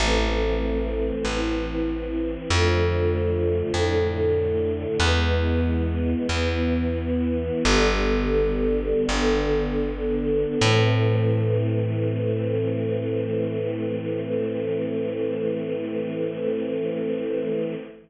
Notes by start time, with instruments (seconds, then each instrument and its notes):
0.00 electric bass (finger) A1, string ensemble 1 E3 A3 C4
1.25 electric bass (finger) A1, string ensemble 1 E3 C4 E4
2.50 electric bass (finger) F2, string ensemble 1 D3 F3 A3
3.74 electric bass (finger) F2, string ensemble 1 A2 D3 A3
4.99 electric bass (finger) E2, string ensemble 1 E3 G#3 B3
6.29 electric bass (finger) E2, string ensemble 1 E3 B3 E4
7.64 electric bass (finger) G1, string ensemble 1 D3 G3 B3
9.08 electric bass (finger) G1, string ensemble 1 D3 B3 D4
10.61 electric bass (finger) A2, string ensemble 1 E3 A3 C4